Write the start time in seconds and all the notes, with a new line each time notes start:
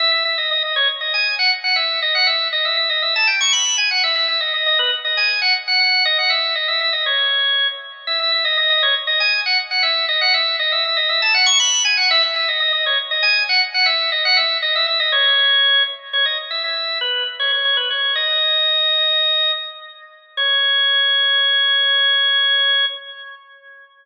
0.00 E5
0.12 E5
0.25 E5
0.38 D#5
0.51 D#5
0.63 D#5
0.76 C#5
1.01 D#5
1.14 G#5
1.39 F#5
1.64 F#5
1.76 E5
2.02 D#5
2.15 F#5
2.27 E5
2.53 D#5
2.65 E5
2.77 E5
2.90 D#5
3.02 E5
3.16 A5
3.27 G5
3.41 C#6
3.53 B5
3.78 G#5
3.91 F#5
4.04 E5
4.16 E5
4.28 E5
4.41 D#5
4.54 D#5
4.66 D#5
4.79 B4
5.05 D#5
5.17 G#5
5.42 F#5
5.68 F#5
5.80 F#5
6.05 D#5
6.19 F#5
6.30 E5
6.55 D#5
6.68 E5
6.81 E5
6.93 D#5
7.06 C#5
8.07 E5
8.20 E5
8.32 E5
8.45 D#5
8.57 D#5
8.70 D#5
8.83 C#5
9.07 D#5
9.20 G#5
9.46 F#5
9.71 F#5
9.83 E5
10.09 D#5
10.21 F#5
10.34 E5
10.59 D#5
10.72 E5
10.85 E5
10.97 D#5
11.09 E5
11.22 A5
11.34 F#5
11.46 C#6
11.60 B5
11.85 G#5
11.97 F#5
12.11 E5
12.23 E5
12.36 E5
12.48 D#5
12.60 D#5
12.73 D#5
12.86 C#5
13.11 D#5
13.23 G#5
13.49 F#5
13.74 F#5
13.86 E5
14.12 D#5
14.25 F#5
14.37 E5
14.62 D#5
14.76 E5
14.87 E5
15.00 D#5
15.12 C#5
16.13 C#5
16.26 D#5
16.51 E5
16.64 E5
17.01 B4
17.39 C#5
17.52 C#5
17.65 C#5
17.77 B4
17.90 C#5
18.15 D#5
20.37 C#5